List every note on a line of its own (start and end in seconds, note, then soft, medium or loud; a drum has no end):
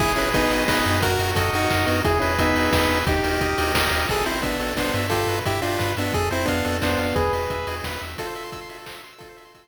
0.00 0.14 G#1 medium
0.00 0.13 E4 medium
0.00 0.13 G#4 medium
0.00 0.51 G#4 medium
0.00 kick loud
0.00 crash medium
0.16 0.32 G#1 medium
0.16 0.30 C#4 medium
0.16 0.30 E4 medium
0.16 0.68 B4 medium
0.16 open hi-hat medium
0.33 0.47 G#1 medium
0.33 0.64 B3 medium
0.33 0.64 D#4 medium
0.33 0.86 D#5 medium
0.33 kick loud
0.33 closed hi-hat loud
0.50 0.65 G#1 medium
0.50 1.00 G#4 medium
0.50 open hi-hat medium
0.68 0.83 G#1 medium
0.68 0.99 B3 medium
0.68 0.99 D#4 medium
0.68 1.01 B4 medium
0.68 kick medium
0.68 snare loud
0.85 1.17 F#2 medium
0.85 1.02 D#5 medium
0.85 open hi-hat medium
1.02 1.53 F#4 medium
1.02 1.31 F#4 medium
1.02 1.31 A#4 medium
1.02 kick loud
1.02 closed hi-hat loud
1.19 1.33 F#2 medium
1.19 1.70 A#4 soft
1.19 open hi-hat medium
1.35 1.50 F#2 medium
1.35 1.51 A4 medium
1.35 1.86 D#5 medium
1.35 kick loud
1.35 closed hi-hat loud
1.53 1.67 F#2 medium
1.53 1.86 D#4 medium
1.53 2.02 F#4 medium
1.53 1.86 F#4 medium
1.53 open hi-hat medium
1.70 1.85 F#2 medium
1.70 2.03 A#4 medium
1.70 kick medium
1.70 clap loud
1.86 2.02 F#2 medium
1.86 2.01 B3 medium
1.86 2.01 D#4 medium
1.86 2.03 D#5 medium
1.86 open hi-hat medium
2.05 2.20 E2 medium
2.05 2.19 E4 medium
2.05 2.19 G#4 medium
2.05 2.55 G#4 medium
2.05 kick loud
2.05 closed hi-hat loud
2.19 2.38 E2 medium
2.19 2.34 C#4 medium
2.19 2.34 E4 medium
2.19 2.72 B4 medium
2.19 open hi-hat medium
2.39 2.53 E2 medium
2.39 2.70 B3 medium
2.39 2.70 D#4 medium
2.39 2.90 E5 medium
2.39 kick medium
2.39 closed hi-hat loud
2.55 2.69 E2 medium
2.55 3.04 G#4 medium
2.55 open hi-hat medium
2.71 2.87 E2 medium
2.71 2.99 B3 medium
2.71 2.99 D#4 medium
2.71 3.05 B4 medium
2.71 kick medium
2.71 snare loud
2.89 3.03 E2 medium
2.89 3.07 E5 medium
2.89 open hi-hat medium
3.06 3.21 D#2 medium
3.06 3.72 D#4 medium
3.06 3.58 G4 medium
3.06 3.72 G4 medium
3.06 kick loud
3.06 closed hi-hat loud
3.23 3.38 D#2 medium
3.23 3.74 A#4 medium
3.23 open hi-hat medium
3.40 3.54 D#2 medium
3.40 3.92 D#5 medium
3.40 kick medium
3.40 closed hi-hat loud
3.58 3.73 D#2 medium
3.58 4.07 G4 medium
3.58 open hi-hat loud
3.74 3.88 D#2 medium
3.74 4.07 A#4 medium
3.74 kick medium
3.74 snare loud
3.91 4.06 D#2 medium
3.91 4.09 D#5 medium
3.91 open hi-hat medium
4.09 4.24 A1 medium
4.09 4.25 G#4 medium
4.09 4.26 A4 medium
4.09 kick medium
4.09 crash medium
4.26 4.42 A1 medium
4.26 4.41 C4 medium
4.26 4.41 E4 medium
4.26 4.43 C5 medium
4.26 open hi-hat medium
4.42 4.59 A1 medium
4.42 4.74 B3 medium
4.42 4.74 D4 medium
4.42 4.60 E5 soft
4.42 kick medium
4.42 closed hi-hat medium
4.59 4.74 A1 medium
4.59 4.77 A4 medium
4.59 open hi-hat medium
4.76 4.90 A1 medium
4.76 5.07 B3 medium
4.76 5.07 D4 medium
4.76 4.95 C5 medium
4.76 kick medium
4.76 snare medium
4.94 5.25 G2 medium
4.94 5.10 E5 medium
4.94 open hi-hat medium
5.10 5.39 F4 medium
5.10 5.28 G4 medium
5.10 5.39 A4 medium
5.10 kick medium
5.10 closed hi-hat medium
5.27 5.41 G2 medium
5.27 5.45 B4 soft
5.27 open hi-hat medium
5.45 5.61 G2 medium
5.45 5.61 E4 medium
5.45 5.61 G4 medium
5.45 5.62 E5 medium
5.45 kick medium
5.45 closed hi-hat medium
5.62 5.78 G2 medium
5.62 5.93 D4 medium
5.62 5.93 F4 medium
5.62 5.80 G4 medium
5.62 open hi-hat medium
5.79 5.95 G2 medium
5.79 5.96 B4 medium
5.79 kick medium
5.79 clap medium
5.97 6.12 G2 medium
5.97 6.14 B3 medium
5.97 6.14 D4 medium
5.97 6.13 E5 soft
5.97 open hi-hat medium
6.14 6.29 F2 medium
6.14 6.29 G#4 medium
6.14 6.31 A4 medium
6.14 kick medium
6.14 closed hi-hat medium
6.31 6.46 F2 medium
6.31 6.46 C4 medium
6.31 6.46 E4 medium
6.31 6.48 C5 medium
6.31 open hi-hat medium
6.46 6.62 F2 medium
6.46 6.77 B3 medium
6.46 6.77 D4 medium
6.46 6.65 F5 medium
6.46 kick medium
6.46 closed hi-hat medium
6.65 6.81 F2 medium
6.65 6.82 A4 medium
6.65 open hi-hat medium
6.82 6.96 F2 medium
6.82 7.16 B3 medium
6.82 7.16 D4 medium
6.82 6.99 C5 medium
6.82 kick medium
6.82 snare medium
6.98 7.13 F2 medium
6.98 7.15 F5 soft
6.98 open hi-hat medium
7.15 7.30 E2 medium
7.15 7.32 G#4 medium
7.15 7.75 G#4 medium
7.15 7.75 B4 medium
7.15 kick medium
7.15 closed hi-hat medium
7.33 7.47 E2 medium
7.33 7.50 B4 soft
7.33 open hi-hat medium
7.50 7.65 E2 medium
7.50 7.67 E5 soft
7.50 kick medium
7.50 closed hi-hat medium
7.67 7.81 E2 medium
7.67 7.85 G#4 medium
7.67 open hi-hat medium
7.83 7.98 E2 medium
7.83 8.02 B4 medium
7.83 kick medium
7.83 snare medium
8.01 8.16 E2 medium
8.01 8.17 E5 soft
8.01 open hi-hat medium
8.18 9.02 F4 medium
8.18 8.27 A4 medium
8.18 9.02 A4 medium
8.18 kick medium
8.18 closed hi-hat loud
8.26 8.34 C5 medium
8.35 8.43 E5 medium
8.35 open hi-hat medium
8.43 8.51 C6 medium
8.52 8.60 E6 medium
8.52 kick medium
8.52 closed hi-hat medium
8.61 8.69 C6 medium
8.69 8.77 E5 medium
8.69 open hi-hat medium
8.78 8.85 A4 medium
8.86 8.94 C5 medium
8.86 kick medium
8.86 clap loud
8.95 9.02 E5 medium
9.03 9.12 C6 medium
9.03 open hi-hat medium
9.12 9.20 E6 medium
9.18 9.68 F4 medium
9.18 9.68 A4 medium
9.18 9.28 A4 medium
9.18 kick medium
9.18 closed hi-hat loud
9.29 9.37 C5 medium
9.37 9.44 E5 medium
9.37 open hi-hat medium
9.45 9.53 C6 medium
9.55 9.62 E6 medium
9.55 kick medium
9.55 closed hi-hat loud
9.63 9.68 C6 medium